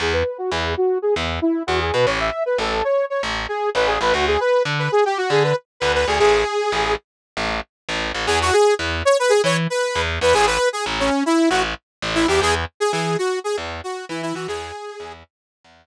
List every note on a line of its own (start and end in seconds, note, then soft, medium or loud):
0.00 0.23 E2 medium
0.00 0.13 G#4 medium
0.13 0.37 B4 medium
0.38 0.50 F#4 medium
0.51 0.75 E2 medium
0.51 0.73 G#4 medium
0.77 0.98 F#4 medium
1.02 1.14 G#4 medium
1.16 1.39 E2 medium
1.42 1.63 E4 medium
1.67 1.91 E2 medium
1.67 1.79 F#4 medium
1.81 1.94 G#4 medium
1.94 2.05 B2 medium
1.94 2.06 B4 medium
2.06 2.30 A1 medium
2.06 2.19 C#5 loud
2.20 2.44 E5 medium
2.46 2.58 B4 medium
2.58 2.82 A1 medium
2.58 2.84 A4 medium
2.84 3.05 C#5 medium
3.10 3.22 C#5 medium
3.23 3.46 A1 medium
3.49 3.70 G#4 medium
3.75 3.98 A1 medium
3.75 3.88 B4 medium
3.87 3.99 G#4 medium
4.01 4.12 A1 medium
4.01 4.14 B4 medium
4.13 4.37 D2 medium
4.13 4.26 F#4 medium
4.27 4.40 G#4 medium
4.40 4.63 B4 medium
4.65 4.89 D3 medium
4.79 4.91 B4 medium
4.92 5.04 G#4 medium
5.06 5.18 G4 medium
5.18 5.30 F#4 medium
5.30 5.53 D3 medium
5.30 5.43 G#4 medium
5.43 5.56 B4 medium
5.80 6.05 D2 medium
5.80 5.93 B4 medium
5.95 6.07 B4 medium
6.08 6.19 D2 medium
6.08 6.19 G#4 medium
6.19 6.44 A1 medium
6.19 6.94 G#4 medium
6.72 6.95 A1 medium
7.37 7.60 A1 medium
7.89 8.12 A1 medium
8.14 8.26 A1 medium
8.27 8.51 E2 medium
8.27 8.39 G#4 loud
8.41 8.54 F#4 loud
8.53 8.74 G#4 medium
8.79 9.02 E2 medium
9.05 9.17 C#5 medium
9.19 9.32 B4 medium
9.29 9.42 G#4 medium
9.44 9.67 E3 medium
9.44 9.57 C#5 medium
9.70 10.02 B4 medium
9.95 10.19 E2 medium
10.21 10.33 E2 medium
10.21 10.34 B4 medium
10.34 10.58 A1 medium
10.34 10.46 G#4 loud
10.47 10.69 B4 medium
10.73 10.85 G#4 medium
10.86 11.09 A1 medium
11.00 11.24 C#4 medium
11.26 11.49 E4 medium
11.50 11.74 A1 medium
11.50 11.62 F#4 medium
12.02 12.26 A1 medium
12.15 12.27 E4 medium
12.28 12.40 E2 medium
12.28 12.41 G4 medium
12.41 12.64 E2 medium
12.41 12.54 G#4 loud
12.80 12.92 G#4 medium
12.93 13.16 E3 medium
12.93 13.17 G#4 medium
13.19 13.39 F#4 medium
13.44 13.56 G#4 medium
13.58 13.81 E2 medium
13.84 14.05 F#4 medium
14.09 14.33 E3 medium
14.09 14.22 E4 medium
14.22 14.35 E4 loud
14.35 14.47 E3 medium
14.35 14.47 F#4 medium
14.48 14.71 E2 medium
14.48 15.12 G#4 loud
15.00 15.23 E2 medium
15.64 15.86 E2 medium